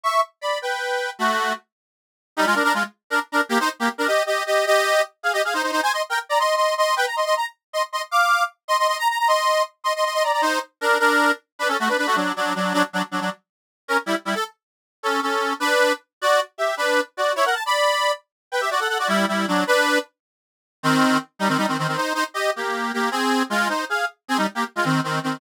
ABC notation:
X:1
M:6/8
L:1/16
Q:3/8=104
K:Bm
V:1 name="Accordion"
[ec']2 z2 [db]2 [Bg]6 | [A,F]4 z8 | [K:Cm] [G,E] [A,F] [DB] [DB] [A,F] z3 [DB] z [DB] z | [B,G] [Ec] z [B,G] z [DB] [Ge]2 [Ge]2 [Ge]2 |
[Ge]4 z2 [Af] [Ge] [Af] [Ec] [Ec] [Ec] | [ca] [ec'] z [Bg] z [db] [ec']2 [ec']2 [ec']2 | [=Bg] _b [ec'] [ec'] b z3 [ec'] z [ec'] z | [fd']4 z2 [ec'] [ec'] [ec'] b b b |
[ec']4 z2 [ec'] [ec'] [ec'] [ec'] [db] [db] | [Ec]2 z2 [DB]2 [DB]4 z2 | [K:Bm] [DB] [CA] [A,F] [DB] [DB] [A,F] [F,D]2 [F,D]2 [F,D]2 | [F,D] z [F,D] z [F,D] [F,D] z6 |
[C^A] z [G,E] z [G,E] =A z6 | [CA]2 [CA]4 [DB]4 z2 | [Fd]2 z2 [Ge]2 [DB]3 z [Fd]2 | [Ec] [^Af] =a [db]5 z4 |
[Bg] [Ge] [Fd] [Af] [Af] [Fd] [G,E]2 [G,E]2 [F,D]2 | [DB]4 z8 | [K:Cm] [E,C]4 z2 [G,E] [E,C] [G,E] [E,C] [E,C] [E,C] | [Ec]2 [Ec] z [Ge]2 [B,G]4 [B,G]2 |
[CA]4 [A,F]2 [Ec]2 [Af]2 z2 | [CA] [G,E] z [B,G] z [A,F] [E,C]2 [E,C]2 [E,C]2 |]